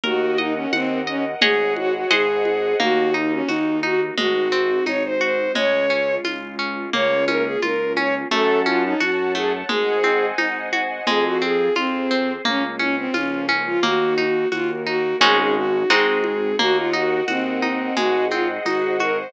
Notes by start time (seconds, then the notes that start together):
0.03 D#2 F#4 A#4 D#5 F#5, low conga
0.37 D#4 D#5, high conga
0.55 C#4
0.73 D#2 C4 F#5, tambourine, high conga
1.07 C#4 D#5
1.41 G#1 G#4 C#5 D#5 F#5, low conga
1.76 F#4, high conga
1.94 F#4
2.11 G#1 G#4 C5 D#5 F#5, tambourine, high conga
2.45 high conga
2.79 D#2 A#3 D#4 F#4, low conga
3.14 D#4
3.32 C#4
3.48 D#2 D#4 F#4, tambourine, high conga
3.83 D#4 F#4, high conga
4.17 G#1 G#3 C4 D#4 F#4, low conga
4.52 C4
4.86 G#1 D#4 C#5, tambourine, high conga
5.05 C5
5.21 F#4 C5
5.55 C#2 G#3 C#4 F4 C#5, low conga
5.90 C#4
6.24 C#2 F4, tambourine, high conga
6.59 C#4
6.92 C#2 A#3 C#4 F4 C#5, low conga
7.28 C#4 A#4, high conga
7.44 G#4
7.62 C#2 F4 A#4, tambourine, high conga
7.96 C#4 C#5, high conga
8.31 F#2 A3 A4 C#5 F#5 A5, low conga
8.66 C#4 F4, high conga
8.84 D#4
9.00 F#2 F#4, tambourine, high conga
9.35 A3 G#4, high conga
9.68 G#1 G#3 G#4 C5 D#5 F#5 G#5, low conga
10.03 C4, high conga
10.38 G#1 D#4, tambourine, high conga
10.73 F#4, high conga
11.06 F2 G#3 C4 F4 G#4, low conga
11.25 F#4
11.42 C4 G#4
11.75 F2 C4 F4 G#4 C5, tambourine, high conga
12.11 C4
12.45 C#2 A#3 C#4 F4, low conga
12.79 C#4, high conga
12.97 C4
13.13 C#2 F3 A#3 C#4 F4, tambourine, high conga
13.48 C#4, high conga
13.67 F4
13.81 D#2 A#3 D#4 F#4, low conga
14.18 D#4, high conga
14.52 D#2 A#3 F4 F#4 A#4, tambourine, high conga
14.86 D#4 F#4
15.20 G#1 G#3 C#4 D#4 F#4 G#4, low conga
15.39 G#4
15.56 F#4
15.90 G#1 G#3 C4 D#4 F#4 G#4, tambourine, high conga
16.24 high conga
16.59 D#2 A#3 F#4 A#4 D#5 F#5, low conga
16.76 F4
16.93 D#4 F#4
17.28 D#2 C4 F#4, tambourine, high conga
17.62 D#4, high conga
17.95 G#1 G#3 F#4 G#4 C5 D#5 F#5, low conga
18.31 C4 F4, high conga
18.64 G#1 D#4 F#4, tambourine, high conga
19.00 F#4 A#4, high conga
19.17 C5